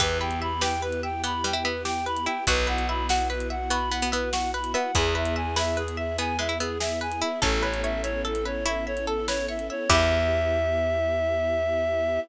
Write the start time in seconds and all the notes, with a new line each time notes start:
0.00 E2 B3 E4 G4 B4, kick, closed hi-hat
0.20 B4 G5
0.31 closed hi-hat
0.42 E5 B5
0.61 G4 B4 G5, snare
0.82 B4
0.92 closed hi-hat
1.03 E5 G5
1.24 B3 G4 B5, closed hi-hat
1.44 G3 B4 G5
1.53 E4, closed hi-hat
1.63 B3 B4 E5
1.85 G4 G5, snare
2.06 B4 B5
2.17 closed hi-hat
2.25 E4 E5 G5
2.46 B1 B3 E4 F#4 B4, kick, closed hi-hat
2.67 B4 F#5
2.78 closed hi-hat
2.88 E5 B5
3.09 F#4 F#5, snare
3.29 B4
3.40 closed hi-hat
3.50 E5 F#5
3.70 B3 F#4 B5, closed hi-hat
3.91 B3 B4 F#5
4.02 B3, closed hi-hat
4.12 B3 B4 E5
4.32 F#4 F#5, snare
4.53 B4 B5
4.64 closed hi-hat
4.74 B3 E5 F#5
4.95 E2 B3 E4 G#4 B4, kick, closed hi-hat
5.15 B4 E5
5.25 closed hi-hat
5.36 E5 G#5
5.56 G#4 B4 E5, snare
5.77 G#4 B4
5.88 closed hi-hat
5.97 E5
6.18 B3 G#4 G#5, closed hi-hat
6.39 G#3 B4 E5
6.49 E4, closed hi-hat
6.59 B3 G#4 E5
6.80 G#4 E5, snare
7.01 B4 G#5
7.12 closed hi-hat
7.21 E4 E5
7.42 A1 B3 C#4 E4 A4, kick, closed hi-hat
7.62 B4 C#5
7.74 closed hi-hat
7.83 C#5 E5
8.03 C#5 E5, closed hi-hat
8.25 A4
8.35 closed hi-hat
8.45 B4 C#5
8.66 E4 C#5 E5, closed hi-hat
8.87 C#5 E5
8.97 closed hi-hat
9.07 A4
9.27 B4 C#5, snare
9.48 C#5 E5
9.59 closed hi-hat
9.70 C#5 E5
9.89 E2 B3 E4 G4 B4 E5, kick, crash